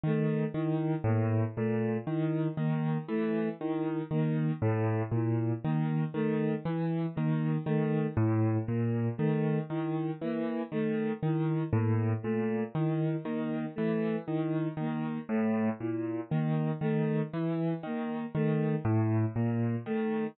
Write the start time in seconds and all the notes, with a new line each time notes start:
0.03 D#3 A3
0.54 D#3 E4
1.04 A2 A#3
1.56 A#2 A3
2.07 D#3 E4
2.57 D#3 A#3
3.08 E3 A3
3.60 D#3 E4
4.11 D#3 A#3
4.62 A2 A3
5.11 A#2 E4
5.64 D#3 A#3
6.14 D#3 A3
6.65 E3 E4
7.15 D#3 A#3
7.66 D#3 A3
8.17 A2 E4
8.67 A#2 A#3
9.18 D#3 A3
9.69 D#3 E4
10.21 E3 A#3
10.72 D#3 A3
11.23 D#3 E4
11.72 A2 A#3
12.23 A#2 A3
12.75 D#3 E4
13.24 D#3 A#3
13.76 E3 A3
14.26 D#3 E4
14.77 D#3 A#3
15.28 A2 A3
15.80 A#2 E4
16.30 D#3 A#3
16.81 D#3 A3
17.33 E3 E4
17.83 D#3 A#3
18.35 D#3 A3
18.85 A2 E4
19.35 A#2 A#3
19.86 D#3 A3